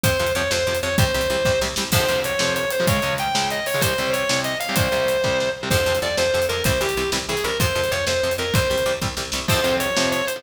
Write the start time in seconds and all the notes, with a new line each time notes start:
0.03 F2 C3 F3 C5, kick, closed hi-hat
0.19 F2 C3 F3
0.27 closed hi-hat
0.35 F2 C3 F3 C#5
0.51 F2 C3 F3 C5, snare
0.67 F2 C3 F3
0.75 closed hi-hat
0.83 F2 C3 F3 C#5
0.98 C2 C3 G3 C5, kick, closed hi-hat
1.14 C2 C3 G3
1.21 closed hi-hat
1.30 C2 C3 G3
1.45 C2 C3 G3, kick, snare
1.61 C2 C3 G3, snare
1.76 C2 C3 G3, snare
1.92 F2 C3 F3 C5, kick, crash
2.09 F2 C3 F3, closed hi-hat
2.24 C#5, closed hi-hat
2.39 F2 C3 F3, snare
2.56 C#5, closed hi-hat
2.71 C5, closed hi-hat
2.80 F2 C3 F3
2.87 C#2 C#3 G#3 C#5, kick, closed hi-hat
3.02 C#2 C#3 G#3, closed hi-hat
3.18 G5, closed hi-hat
3.35 C#2 C#3 G#3, snare
3.50 D#5, closed hi-hat
3.66 C#5, open hi-hat
3.74 C#2 C#3 G#3
3.81 C2 C3 G3 C5, kick, closed hi-hat
3.98 C2 C3 G3, closed hi-hat
4.13 C#5, closed hi-hat
4.29 C2 C3 G3, snare
4.44 D#5, closed hi-hat
4.60 F5, closed hi-hat
4.69 C2 C3 G3
4.76 C2 C3 G3 C5, kick, closed hi-hat
4.92 C2 C3 G3, closed hi-hat
5.08 closed hi-hat
5.24 C2 C3 G3, kick, snare
5.40 snare
5.63 C2 C3 G3
5.70 F2 C3 F3 C5, kick, crash
5.86 F2 C3 F3
5.95 closed hi-hat
6.02 F2 C3 F3 D5
6.17 F2 C3 F3 C5, snare
6.33 F2 C3 F3
6.42 closed hi-hat
6.49 F2 C3 F3 A#4
6.64 C2 C3 E3 G3 C5, kick, closed hi-hat
6.80 C2 C3 E3 G3 G4
6.89 closed hi-hat
6.97 C2 C3 E3 G3
7.12 C2 C3 E3 G3, snare
7.28 C2 C3 E3 G3 G#4
7.37 closed hi-hat
7.44 C2 C3 E3 G3 A#4
7.60 F2 C3 F3 C5, kick, closed hi-hat
7.75 F2 C3 F3
7.84 closed hi-hat
7.91 F2 C3 F3 C#5
8.07 F2 C3 F3 C5, snare
8.23 F2 C3 F3
8.31 closed hi-hat
8.38 F2 C3 F3 A#4
8.53 C2 C3 G3 C5, kick, closed hi-hat
8.70 C2 C3 G3
8.78 closed hi-hat
8.86 C2 C3 G3
9.01 C2 C3 G3, kick, snare
9.17 C2 C3 G3, snare
9.32 C2 C3 G3, snare
9.48 F2 C3 F3 C5, kick, crash
9.64 F2 C3 F3, closed hi-hat
9.80 C#5, closed hi-hat
9.96 F2 C3 F3, snare
10.12 C#5, closed hi-hat
10.27 C5, closed hi-hat
10.36 F2 C3 F3